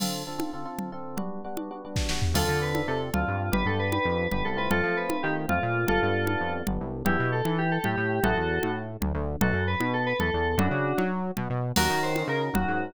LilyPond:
<<
  \new Staff \with { instrumentName = "Electric Piano 2" } { \time 9/8 \key d \dorian \tempo 4. = 153 r1 r8 | r1 r8 | <f' a'>4 b'4 a'8 r8 f'4. | b'8 a'8 b'8 b'4. b'8 a'8 b'8 |
<f' a'>4 b'4 g'8 r8 f'4. | <f' a'>2~ <f' a'>8 r2 | \key e \dorian <e' g'>4 a'4 g'8 a'8 g'4. | <fis' a'>2 r2 r8 |
<fis' a'>4 b'4 a'8 b'8 a'4. | <d' fis'>2 r2 r8 | \key ees \dorian <ges' bes'>4 c''4 bes'8 r8 ges'4. | }
  \new Staff \with { instrumentName = "Electric Piano 1" } { \time 9/8 \key d \dorian <d c' f' a'>4 <d c' f' a'>8 <d c' f' a'>8 <d c' f' a'>8 <d c' f' a'>4 <d c' f' a'>4 | <g b d' fis'>4 <g b d' fis'>8 <g b d' fis'>8 <g b d' fis'>8 <g b d' fis'>4 <g b d' fis'>4 | <c' d' f' a'>8 <c' d' f' a'>4 <c' d' f' a'>4. <c' d' f' a'>4. | <b d' g'>8 <b d' g'>4 <b d' g'>4. <b d' g'>4 <a c' f'>8~ |
<a c' f'>8 <a c' f'>4 <a c' f'>4. <a c' f'>4. | <g b d'>8 <g b d'>4 <g b d'>4. <g b d'>4. | \key e \dorian <b d' e' g'>8 b4 e'4. a8 a4 | <a cis' e' gis'>8 e4 a4. d8 d4 |
<a b dis' fis'>8 fis4 b4. e8 e4 | <a cis' e' fis'>8 cis'4 fis'4. b8 b4 | \key ees \dorian <des' ees' ges' bes'>8 <des' ees' ges' bes'>4 <des' ees' ges' bes'>4. <des' ees' ges' bes'>4. | }
  \new Staff \with { instrumentName = "Synth Bass 1" } { \clef bass \time 9/8 \key d \dorian r1 r8 | r1 r8 | d,8 d4. c4 d,8 g,4 | g,,8 g,4. f,4 g,,8 c,4 |
f,8 f4. ees4 f,8 bes,4 | g,,8 g,4. f,4 g,,8 c,4 | \key e \dorian e,8 b,4 e4. a,8 a,4 | a,,8 e,4 a,4. d,8 d,4 |
b,,8 fis,4 b,4. e,8 e,4 | fis,8 cis4 fis4. b,8 b,4 | \key ees \dorian ees,8 ees4. des4 ees,8 aes,4 | }
  \new DrumStaff \with { instrumentName = "Drums" } \drummode { \time 9/8 <cgl cymc>4. cgho4. cgl4. | cgl4. cgho4. <bd sn>8 sn8 tomfh8 | <cgl cymc>4. cgho4. cgl4. | cgl4. cgho4. cgl4. |
cgl4. cgho4. cgl4. | cgl4. cgho4. cgl4. | cgl4. cgho4. cgl4. | cgl4. cgho4. cgl4. |
cgl4. cgho4. cgl4. | cgl4. cgho4. cgl4. | <cgl cymc>4. cgho4. cgl4. | }
>>